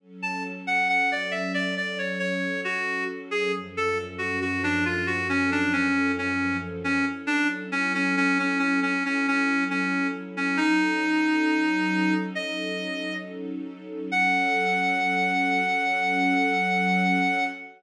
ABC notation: X:1
M:4/4
L:1/16
Q:1/4=68
K:F#m
V:1 name="Clarinet"
z a z f f d e d d c c2 F2 z G | z A z F F D ^E F C D C2 C2 z C | z D z C C C C C C C C2 C2 z C | ^D8 ^d4 z4 |
f16 |]
V:2 name="String Ensemble 1"
[F,CA]16 | [F,,^E,CA]16 | [F,CEA]16 | [F,C^DA]16 |
[F,CA]16 |]